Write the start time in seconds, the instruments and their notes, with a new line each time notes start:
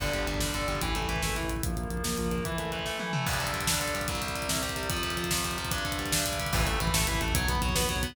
0.00 synth bass 1 G1, overdriven guitar D3, kick, crash
0.07 kick
0.13 synth bass 1 G1, overdriven guitar G3, kick, closed hi-hat
0.20 kick
0.27 synth bass 1 G1, overdriven guitar D3, kick, closed hi-hat
0.34 kick
0.39 synth bass 1 G1, overdriven guitar G3, kick, snare
0.47 kick
0.54 synth bass 1 G1, overdriven guitar D3, kick, closed hi-hat
0.62 kick
0.68 synth bass 1 G1, overdriven guitar G3, kick, closed hi-hat
0.75 kick
0.81 synth bass 1 A1, overdriven guitar E3, kick, closed hi-hat
0.88 kick
0.95 synth bass 1 A1, overdriven guitar A3, kick, closed hi-hat
1.02 kick
1.08 synth bass 1 A1, overdriven guitar E3, kick, closed hi-hat
1.16 kick
1.22 synth bass 1 G#1, overdriven guitar A3, kick, snare
1.29 kick
1.36 overdriven guitar E3, kick, closed hi-hat
1.43 synth bass 1 A1, kick
1.49 overdriven guitar A3, kick, closed hi-hat
1.56 kick
1.63 synth bass 1 A#1, overdriven guitar F3, kick, closed hi-hat
1.70 kick
1.76 synth bass 1 A#1, overdriven guitar A#3, kick, closed hi-hat
1.83 kick
1.90 synth bass 1 A#1, overdriven guitar F3, kick, closed hi-hat
1.97 kick
2.04 synth bass 1 A#1, overdriven guitar A#3, kick, snare
2.11 kick
2.18 synth bass 1 A#1, overdriven guitar F3, kick, closed hi-hat
2.24 kick
2.30 synth bass 1 A#1, overdriven guitar A#3, kick, closed hi-hat
2.38 kick
2.45 overdriven guitar E3, kick, closed hi-hat
2.52 kick
2.58 overdriven guitar A3, kick, closed hi-hat
2.65 kick
2.72 overdriven guitar E3, kick, closed hi-hat
2.79 kick
2.86 overdriven guitar A3, kick, snare
2.99 overdriven guitar E3, high tom
3.13 overdriven guitar A3, mid tom
3.26 overdriven guitar G2, kick, crash
3.33 kick, closed hi-hat
3.40 overdriven guitar D3, kick, closed hi-hat
3.47 kick, closed hi-hat
3.53 overdriven guitar G3, kick, closed hi-hat
3.60 kick, closed hi-hat
3.67 overdriven guitar G2, kick, snare
3.74 kick, closed hi-hat
3.81 overdriven guitar D3, kick, closed hi-hat
3.87 kick, closed hi-hat
3.94 overdriven guitar G3, kick, closed hi-hat
4.01 kick, closed hi-hat
4.08 overdriven guitar C2, kick, closed hi-hat
4.15 kick, closed hi-hat
4.22 overdriven guitar C3, kick, closed hi-hat
4.28 kick, closed hi-hat
4.35 overdriven guitar G3, kick, closed hi-hat
4.42 kick, closed hi-hat
4.49 overdriven guitar C2, kick, snare
4.56 kick, closed hi-hat
4.63 overdriven guitar C3, kick, closed hi-hat
4.69 kick, closed hi-hat
4.76 overdriven guitar G3, kick, closed hi-hat
4.83 kick, closed hi-hat
4.90 overdriven guitar F2, kick, closed hi-hat
4.97 kick, closed hi-hat
5.03 overdriven guitar C3, kick, closed hi-hat
5.10 kick, closed hi-hat
5.17 overdriven guitar F3, kick, closed hi-hat
5.24 kick, closed hi-hat
5.30 overdriven guitar F2, kick, snare
5.37 kick, closed hi-hat
5.44 overdriven guitar C3, kick, closed hi-hat
5.51 kick, closed hi-hat
5.58 overdriven guitar F3, kick, closed hi-hat
5.65 kick, closed hi-hat
5.71 overdriven guitar G2, kick, closed hi-hat
5.78 kick, closed hi-hat
5.85 overdriven guitar D3, kick, closed hi-hat
5.92 kick, closed hi-hat
5.98 overdriven guitar G3, kick, closed hi-hat
6.05 kick, closed hi-hat
6.12 overdriven guitar G2, kick, snare
6.19 kick, closed hi-hat
6.26 overdriven guitar D3, kick, closed hi-hat
6.32 kick, closed hi-hat
6.39 overdriven guitar G3, kick, closed hi-hat
6.46 kick, closed hi-hat
6.53 synth bass 1 A1, overdriven guitar E3, kick, crash
6.60 kick
6.66 synth bass 1 A1, overdriven guitar A3, kick, closed hi-hat
6.74 kick
6.79 synth bass 1 A1, overdriven guitar E3, kick, closed hi-hat
6.87 kick
6.94 synth bass 1 A1, overdriven guitar A3, kick, snare
7.01 kick
7.07 synth bass 1 A1, overdriven guitar E3, kick, closed hi-hat
7.15 kick
7.21 synth bass 1 A1, overdriven guitar A3, kick, closed hi-hat
7.28 kick
7.35 synth bass 1 B1, overdriven guitar F#3, kick, closed hi-hat
7.42 kick
7.48 synth bass 1 B1, overdriven guitar B3, kick, closed hi-hat
7.55 kick
7.62 synth bass 1 B1, overdriven guitar F#3, kick, closed hi-hat
7.69 kick
7.75 synth bass 1 A#1, overdriven guitar B3, kick, snare
7.82 kick
7.89 overdriven guitar F#3, kick, closed hi-hat
7.96 synth bass 1 B1, kick
8.03 overdriven guitar B3, kick, closed hi-hat
8.09 kick